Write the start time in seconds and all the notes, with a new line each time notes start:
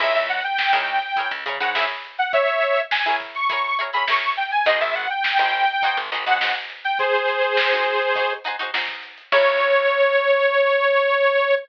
0.00 C#2 E4 G#4 A#4 C#5 E5, kick, crash
0.15 C#2 E5, closed hi-hat
0.29 F#5, closed hi-hat
0.44 G5, closed hi-hat
0.58 G5, snare
0.73 C#2 E4 G#4 A#4 C#5 G5, closed hi-hat
0.87 snare, closed hi-hat
1.02 snare, closed hi-hat
1.16 E4 G#4 A#4 C#5, kick, closed hi-hat
1.31 C#2, closed hi-hat
1.46 C#3 E4 G#4 A#4 C#5, closed hi-hat
1.60 G#2 E4 G#4 A#4 C#5 F#5, closed hi-hat
1.75 E4 G#4 A#4 C#5 E5, snare
1.89 closed hi-hat
2.04 closed hi-hat
2.18 F#5, closed hi-hat
2.33 C#5 E5, kick, closed hi-hat
2.47 closed hi-hat
2.62 closed hi-hat
2.77 closed hi-hat
2.91 G#5, snare
3.06 E4 G#4 A#4 C#5, closed hi-hat
3.20 kick, snare, closed hi-hat
3.35 C#6, closed hi-hat
3.50 E4 G#4 A#4 C#5, kick, closed hi-hat
3.64 snare, closed hi-hat
3.79 E4 G#4 A#4 C#5, closed hi-hat
3.93 E4 G#4 A#4 C#5 B5, closed hi-hat
4.08 E4 G#4 A#4 C#5 C#6, snare
4.22 closed hi-hat
4.37 G5, closed hi-hat
4.51 G#5, closed hi-hat
4.66 G#1 D#4 F#4 G#4 C5 D#5, kick, closed hi-hat
4.81 G#1 E5, closed hi-hat
4.95 F#5, snare, closed hi-hat
5.10 G5, closed hi-hat
5.24 G5, snare
5.39 G#1 D#4 F#4 G#4 C5 G5, closed hi-hat
5.53 closed hi-hat
5.68 closed hi-hat
5.82 D#4 F#4 G#4 C5, kick, closed hi-hat
5.97 G#1, closed hi-hat
6.12 G#1 D#4 F#4 G#4 C5, snare, closed hi-hat
6.26 D#2 D#4 F#4 G#4 C5 F#5, closed hi-hat
6.41 D#4 F#4 G#4 C5 F#5, snare
6.55 closed hi-hat
6.70 closed hi-hat
6.84 G5, closed hi-hat
6.99 G#4 C5, kick, closed hi-hat
7.14 closed hi-hat
7.28 snare, closed hi-hat
7.42 closed hi-hat
7.57 snare
7.72 D#4 F#4 G#4 C5, closed hi-hat
7.86 closed hi-hat
8.01 closed hi-hat
8.15 D#4 F#4 G#4 C5, kick, closed hi-hat
8.30 closed hi-hat
8.44 D#4 F#4 G#4 C5, closed hi-hat
8.59 D#4 F#4 G#4 C5, closed hi-hat
8.74 D#4 F#4 G#4 C5, snare
8.88 kick, snare, closed hi-hat
9.03 closed hi-hat
9.18 closed hi-hat
9.32 C#2 E4 G#4 A#4 C#5, kick, crash